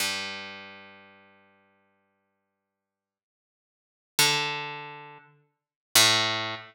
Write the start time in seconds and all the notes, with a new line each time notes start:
0.00 G2
4.19 D3
5.95 A2